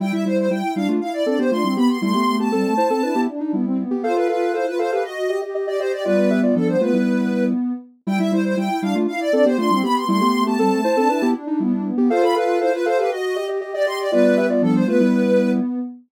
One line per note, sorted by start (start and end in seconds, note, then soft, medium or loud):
0.00 0.12 G3 medium
0.00 0.12 E4 loud
0.00 0.25 E4 loud
0.00 0.12 G5 medium
0.12 0.25 G3 medium
0.12 0.25 E4 medium
0.12 0.24 E5 medium
0.25 0.49 G3 medium
0.25 0.46 E4 medium
0.25 0.49 E4 medium
0.25 0.37 C5 medium
0.38 0.50 C5 medium
0.50 0.63 G3 medium
0.50 0.62 E4 medium
0.50 0.63 E4 medium
0.50 0.74 G5 medium
0.63 0.75 E4 medium
0.76 0.88 G3 medium
0.76 0.96 D4 medium
0.76 0.88 E4 medium
0.76 0.88 F5 medium
0.88 1.00 A3 medium
0.88 1.00 F4 medium
1.01 1.23 E4 medium
1.01 1.13 F5 medium
1.13 1.25 D5 medium
1.26 1.38 C4 medium
1.26 1.38 D4 medium
1.26 1.38 A4 medium
1.26 1.38 D5 medium
1.39 1.51 B3 medium
1.39 1.51 G4 medium
1.39 1.51 C5 medium
1.51 1.63 A3 medium
1.51 1.63 D4 medium
1.51 1.63 F4 medium
1.51 1.74 C6 medium
1.64 1.76 G3 medium
1.64 1.76 C4 medium
1.64 1.76 E4 medium
1.76 1.88 B3 medium
1.76 1.98 B3 medium
1.76 1.98 G4 medium
1.76 1.88 B5 medium
1.89 2.01 B3 medium
1.89 2.01 C6 medium
2.02 2.14 G3 medium
2.02 2.23 A3 loud
2.02 2.14 E4 loud
2.02 2.36 C6 medium
2.14 2.38 B3 medium
2.14 2.38 G4 medium
2.27 2.49 A3 medium
2.40 2.52 B3 medium
2.40 2.52 G4 medium
2.40 3.21 A5 medium
2.52 2.64 G3 medium
2.52 2.74 C4 medium
2.52 2.74 A4 medium
2.65 2.77 A3 medium
2.77 2.89 E4 medium
2.77 2.89 C5 medium
2.90 3.02 C4 medium
2.90 3.02 A4 medium
3.03 3.15 D4 medium
3.03 3.27 E4 medium
3.03 3.15 B4 medium
3.15 3.27 B3 medium
3.15 3.27 G4 medium
3.28 3.40 D4 medium
3.40 3.52 D4 medium
3.40 3.52 D#4 medium
3.53 3.84 G3 medium
3.53 3.65 B3 medium
3.53 3.84 E4 medium
3.65 3.77 C4 medium
3.78 3.90 B3 medium
3.91 4.03 B3 medium
3.91 4.03 G4 medium
4.03 4.28 F4 medium
4.03 4.15 A4 medium
4.03 4.15 C5 medium
4.03 4.15 F5 medium
4.16 4.28 A4 medium
4.16 4.28 B4 medium
4.16 4.28 F5 medium
4.28 4.50 F4 medium
4.28 4.52 A4 medium
4.28 4.53 B4 medium
4.28 4.52 F5 medium
4.54 4.66 E4 medium
4.54 4.66 A4 medium
4.54 4.66 C5 medium
4.54 4.66 F5 medium
4.66 4.78 F4 medium
4.66 4.78 B4 medium
4.79 4.91 A4 medium
4.79 4.91 C5 medium
4.79 4.91 F5 medium
4.91 5.04 G4 medium
4.91 5.04 A4 medium
4.91 5.03 B4 medium
4.91 5.04 F5 medium
5.04 5.28 F#4 medium
5.04 5.39 D#5 medium
5.29 5.41 G4 medium
5.29 5.41 D#5 medium
5.42 5.54 G4 medium
5.42 5.54 D#5 medium
5.55 5.67 G4 medium
5.55 5.67 D#5 medium
5.67 5.79 G4 medium
5.67 5.79 D5 medium
5.67 5.79 D#5 medium
5.80 5.92 G4 medium
5.80 6.04 G4 medium
5.80 5.92 C5 medium
5.80 6.04 D#5 medium
5.92 6.04 G4 medium
5.92 6.04 D5 medium
6.05 6.78 G3 medium
6.05 6.78 B3 medium
6.05 6.17 F4 medium
6.05 6.40 B4 medium
6.05 6.17 D5 loud
6.18 6.30 F4 medium
6.18 6.30 D5 medium
6.30 6.42 G4 medium
6.30 6.42 E5 medium
6.43 6.55 F4 medium
6.43 6.55 D5 medium
6.55 6.76 F3 medium
6.55 6.76 D4 medium
6.55 6.68 A4 medium
6.68 6.80 C5 medium
6.81 6.93 A3 medium
6.81 7.72 B3 medium
6.81 6.93 F4 medium
6.81 7.44 B4 medium
6.93 7.53 G3 medium
6.93 7.53 E4 medium
8.07 8.19 G3 loud
8.07 8.19 E4 loud
8.07 8.31 E4 loud
8.07 8.19 G5 medium
8.19 8.31 G3 medium
8.19 8.31 E4 medium
8.19 8.31 E5 medium
8.32 8.55 G3 medium
8.32 8.53 E4 medium
8.32 8.55 E4 medium
8.32 8.44 C5 medium
8.45 8.57 C5 medium
8.57 8.69 G3 medium
8.57 8.69 E4 medium
8.57 8.80 G5 medium
8.70 8.82 E4 medium
8.82 8.94 G3 medium
8.82 9.03 D4 loud
8.82 8.94 E4 medium
8.82 8.94 F5 medium
8.95 9.07 A3 medium
8.95 9.07 F4 loud
9.08 9.30 E4 medium
9.08 9.20 F5 medium
9.20 9.32 D5 loud
9.33 9.45 C4 medium
9.33 9.45 D4 medium
9.33 9.45 A4 loud
9.33 9.45 D5 medium
9.45 9.57 B3 medium
9.45 9.57 G4 loud
9.45 9.57 C5 medium
9.58 9.70 A3 medium
9.58 9.70 D4 loud
9.58 9.70 F4 medium
9.58 9.80 C6 medium
9.71 9.83 G3 medium
9.71 9.83 C4 loud
9.71 9.83 E4 medium
9.83 10.05 B3 medium
9.83 9.95 B3 loud
9.83 10.05 G4 medium
9.83 9.95 B5 medium
9.96 10.08 B3 medium
9.96 10.08 C6 medium
10.08 10.20 G3 loud
10.08 10.30 A3 loud
10.08 10.20 E4 loud
10.08 10.43 C6 medium
10.21 10.44 B3 medium
10.21 10.44 G4 medium
10.34 10.56 A3 medium
10.46 10.58 B3 medium
10.46 10.58 G4 medium
10.46 11.28 A5 medium
10.59 10.71 G3 medium
10.59 10.81 C4 medium
10.59 10.81 A4 loud
10.71 10.83 A3 medium
10.84 10.96 E4 medium
10.84 10.96 C5 loud
10.97 11.09 C4 medium
10.97 11.09 D4 medium
10.97 11.09 A4 loud
11.09 11.21 D4 medium
11.09 11.34 E4 loud
11.09 11.21 B4 medium
11.22 11.34 B3 medium
11.22 11.34 G4 loud
11.35 11.47 D4 loud
11.47 11.59 D4 medium
11.47 11.59 D#4 medium
11.60 11.91 G3 medium
11.60 11.72 B3 loud
11.60 11.91 E4 medium
11.72 11.84 D4 loud
11.85 11.97 B3 medium
11.97 12.09 B3 medium
11.97 12.10 B3 medium
11.97 12.09 G4 loud
12.10 12.35 F4 loud
12.10 12.22 A4 medium
12.10 12.22 C5 medium
12.10 12.22 F5 loud
12.23 12.35 A4 medium
12.23 12.35 F5 medium
12.23 12.35 B5 medium
12.35 12.57 F4 medium
12.35 12.59 A4 medium
12.35 12.60 B4 medium
12.35 12.59 F5 medium
12.61 12.72 E4 medium
12.61 12.73 A4 medium
12.61 12.72 C5 medium
12.61 12.73 F5 medium
12.73 12.85 F4 medium
12.73 12.85 B4 medium
12.86 12.98 A4 medium
12.86 12.97 C5 medium
12.86 12.98 F5 medium
12.98 13.10 G4 medium
12.98 13.10 A4 medium
12.98 13.10 B4 medium
12.98 13.10 F5 medium
13.11 13.35 F#4 medium
13.11 13.46 D#5 medium
13.36 13.48 G4 medium
13.36 13.48 D#5 medium
13.49 13.61 G4 medium
13.49 13.61 D#5 medium
13.61 13.73 G4 medium
13.61 13.73 D#5 medium
13.74 13.86 G4 medium
13.74 13.86 D5 medium
13.74 13.86 D#5 medium
13.86 13.98 G4 loud
13.86 14.11 G4 medium
13.86 14.11 D#5 medium
13.86 13.99 C6 medium
13.99 14.11 G4 medium
13.99 14.11 D5 medium
14.12 14.85 G3 medium
14.12 14.85 B3 loud
14.12 14.24 F4 loud
14.12 14.47 B4 medium
14.12 14.24 D5 loud
14.24 14.36 F4 medium
14.24 14.36 D5 medium
14.37 14.49 G4 medium
14.37 14.49 E5 medium
14.50 14.62 F4 medium
14.50 14.62 D5 medium
14.62 14.83 F3 medium
14.62 14.83 D4 medium
14.62 14.74 A4 medium
14.75 14.87 C5 medium
14.87 14.99 A3 medium
14.87 15.79 B3 loud
14.87 14.99 F4 medium
14.87 15.51 B4 medium
15.00 15.60 G3 medium
15.00 15.60 E4 loud